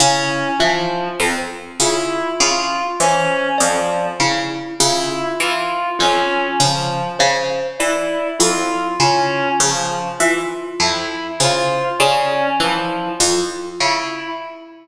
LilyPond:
<<
  \new Staff \with { instrumentName = "Pizzicato Strings" } { \clef bass \time 2/4 \tempo 4 = 50 des8 e8 f,8 des8 | des8 e8 f,8 des8 | des8 e8 f,8 des8 | des8 e8 f,8 des8 |
des8 e8 f,8 des8 | des8 e8 f,8 des8 | }
  \new Staff \with { instrumentName = "Clarinet" } { \time 2/4 des'8 f8 r8 e'8 | f'8 des'8 f8 r8 | e'8 f'8 des'8 f8 | r8 e'8 f'8 des'8 |
f8 r8 e'8 f'8 | des'8 f8 r8 e'8 | }
  \new Staff \with { instrumentName = "Kalimba" } { \time 2/4 e'8 f'8 r8 f'8 | r8 c''8 d''8 e'8 | f'8 r8 f'8 r8 | c''8 d''8 e'8 f'8 |
r8 f'8 r8 c''8 | d''8 e'8 f'8 r8 | }
>>